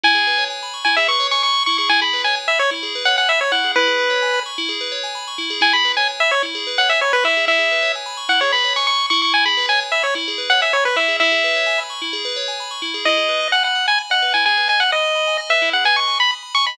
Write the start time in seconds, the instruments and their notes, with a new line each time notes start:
0.03 tubular bells E4, lead 1 (square) G#5
0.15 tubular bells G#4
0.27 tubular bells B4
0.38 tubular bells C#5
0.50 tubular bells G#5
0.63 tubular bells B5
0.74 tubular bells C#6
0.85 tubular bells E4, lead 1 (square) G#5
0.97 tubular bells G#4, lead 1 (square) E5
1.08 tubular bells B4, lead 1 (square) C#6
1.20 tubular bells C#5
1.31 tubular bells G#5, lead 1 (square) C#6
1.43 tubular bells B5, lead 1 (square) C#6
1.54 tubular bells C#6
1.66 tubular bells E4, lead 1 (square) C#6
1.78 tubular bells G#4, lead 1 (square) C#6
1.89 tubular bells E4, lead 1 (square) G#5
2.01 tubular bells G#4, lead 1 (square) B5
2.13 tubular bells B4
2.24 tubular bells C#5, lead 1 (square) G#5
2.36 tubular bells G#5
2.48 lead 1 (square) E5, tubular bells B5
2.59 lead 1 (square) C#5, tubular bells C#6
2.71 tubular bells E4
2.83 tubular bells G#4
2.95 tubular bells B4
3.05 tubular bells C#5, lead 1 (square) F#5
3.18 lead 1 (square) F#5, tubular bells G#5
3.29 lead 1 (square) E5, tubular bells B5
3.41 lead 1 (square) C#5, tubular bells C#6
3.52 tubular bells E4, lead 1 (square) F#5
3.64 tubular bells G#4
3.76 tubular bells E4, lead 1 (square) B4
3.87 tubular bells G#4
3.99 tubular bells B4
4.10 tubular bells C#5
4.22 tubular bells G#5
4.34 tubular bells B5
4.46 tubular bells C#6
4.58 tubular bells E4
4.69 tubular bells G#4
4.81 tubular bells B4
4.92 tubular bells C#5
5.03 tubular bells G#5
5.15 tubular bells B5
5.28 tubular bells C#6
5.38 tubular bells E4
5.50 tubular bells G#4
5.61 tubular bells E4, lead 1 (square) G#5
5.73 tubular bells G#4, lead 1 (square) B5
5.85 tubular bells B4
5.97 tubular bells C#5, lead 1 (square) G#5
6.08 tubular bells G#5
6.20 lead 1 (square) E5, tubular bells B5
6.31 lead 1 (square) C#5, tubular bells C#6
6.43 tubular bells E4
6.55 tubular bells G#4
6.67 tubular bells B4
6.78 tubular bells C#5, lead 1 (square) F#5
6.89 lead 1 (square) E5, tubular bells G#5
7.01 lead 1 (square) C#5, tubular bells B5
7.13 lead 1 (square) B4, tubular bells C#6
7.24 tubular bells E4, lead 1 (square) E5
7.37 tubular bells G#4
7.47 tubular bells E4, lead 1 (square) E5
7.59 tubular bells G#4
7.71 tubular bells B4
7.82 tubular bells C#5
7.95 tubular bells G#5
8.06 tubular bells B5
8.17 tubular bells C#6
8.29 tubular bells E4, lead 1 (square) F#5
8.41 tubular bells G#4, lead 1 (square) C#5
8.52 tubular bells B4, lead 1 (square) B5
8.64 tubular bells C#5
8.76 tubular bells G#5, lead 1 (square) C#6
8.87 tubular bells B5, lead 1 (square) C#6
8.99 tubular bells C#6
9.10 tubular bells E4, lead 1 (square) C#6
9.22 lead 1 (square) C#6
9.34 lead 1 (square) G#5
9.45 tubular bells G#4, lead 1 (square) B5
9.57 tubular bells B4
9.69 tubular bells C#5, lead 1 (square) G#5
9.80 tubular bells G#5
9.92 lead 1 (square) E5, tubular bells B5
10.03 lead 1 (square) C#5, tubular bells C#6
10.15 tubular bells E4
10.28 tubular bells G#4
10.38 tubular bells B4
10.50 tubular bells C#5, lead 1 (square) F#5
10.62 lead 1 (square) E5, tubular bells G#5
10.73 lead 1 (square) C#5, tubular bells B5
10.85 lead 1 (square) B4, tubular bells C#6
10.96 tubular bells E4, lead 1 (square) E5
11.08 tubular bells G#4
11.20 tubular bells E4, lead 1 (square) E5
11.32 tubular bells G#4
11.44 tubular bells B4
11.55 tubular bells C#5
11.66 tubular bells G#5
11.78 tubular bells B5
11.90 tubular bells C#6
12.02 tubular bells E4
12.13 tubular bells G#4
12.25 tubular bells B4
12.36 tubular bells C#5
12.48 tubular bells G#5
12.60 tubular bells B5
12.71 tubular bells C#6
12.82 tubular bells E4
12.94 tubular bells G#4
13.05 tubular bells E4, lead 1 (square) D#5
13.17 tubular bells G#4
13.29 tubular bells B4
13.41 tubular bells D#5
13.52 lead 1 (square) F#5, tubular bells G#5
13.64 lead 1 (square) F#5, tubular bells B5
13.75 tubular bells D#6
13.87 lead 1 (square) G#5, tubular bells B5
13.98 tubular bells G#5
14.10 tubular bells D#5, lead 1 (square) F#5
14.22 tubular bells B4
14.34 tubular bells E4, lead 1 (square) G#5
14.46 tubular bells G#4, lead 1 (square) G#5
14.57 tubular bells B4
14.68 tubular bells D#5, lead 1 (square) G#5
14.80 lead 1 (square) F#5, tubular bells G#5
14.92 lead 1 (square) D#5, tubular bells B5
15.04 tubular bells D#6
15.15 tubular bells B5
15.27 tubular bells G#5
15.38 tubular bells D#5
15.50 tubular bells B4, lead 1 (square) E5
15.62 tubular bells E4
15.73 tubular bells G#4, lead 1 (square) F#5
15.85 tubular bells B4, lead 1 (square) G#5
15.96 tubular bells D#5, lead 1 (square) C#6
16.07 tubular bells G#5
16.20 tubular bells B5, lead 1 (square) B5
16.31 tubular bells D#6
16.43 tubular bells B5
16.55 tubular bells G#5, lead 1 (square) C#6
16.66 tubular bells D#5, lead 1 (square) B5